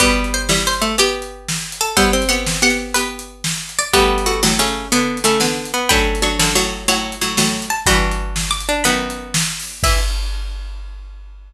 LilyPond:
<<
  \new Staff \with { instrumentName = "Harpsichord" } { \time 12/8 \key e \minor \tempo 4. = 122 <g' b'>4 c''4 c''4 g'2~ g'8 a'8 | <c'' e''>4 fis''4 fis''4 b'2~ b'8 d''8 | <g' b'>2. r2. | <g'' b''>4 cis'''4 cis'''4 fis''2~ fis''8 a''8 |
<g'' b''>2 d'''4 b''2 r4 | e''4. r1 r8 | }
  \new Staff \with { instrumentName = "Harpsichord" } { \time 12/8 \key e \minor <g b>2~ <g b>8 a8 g'2. | b8 c'2. r2 r8 | <g b>2 cis'4 b4 a8 r4 b8 | <a cis'>2. cis''2 r4 |
<d' fis'>2~ <d' fis'>8 d'8 b2 r4 | e'4. r1 r8 | }
  \new Staff \with { instrumentName = "Harpsichord" } { \time 12/8 \key e \minor <b, g>4. <g e'>4. <b g'>2. | <g e'>4 <b g'>4 <b g'>4 <b g'>2~ <b g'>8 r8 | <a fis'>4 <a fis'>8 <a, fis>8 <cis a>4 <d b>4 <cis a>8 <d b>4 r8 | <fis d'>4 <fis d'>8 <fis, d>8 <a, fis>4 <a, fis>4 <a, fis>8 <a, fis>4 r8 |
<g, e>2 r4 <fis, dis>2 r4 | e4. r1 r8 | }
  \new DrumStaff \with { instrumentName = "Drums" } \drummode { \time 12/8 <hh bd>8. hh8. sn8. hh8. hh8. hh8. sn8. hh8. | <hh bd>8. hh8. sn8. hh8. hh8. hh8. sn8. hh8. | <hh bd>8. hh8. sn8. hh8. hh8. hh8. sn8. hh8. | <hh bd>8. hh8. sn8. hh8. hh8. hh8. sn8. hh8. |
<hh bd>8. hh8. sn8. hh8. hh8. hh8. sn8. hho8. | <cymc bd>4. r4. r4. r4. | }
>>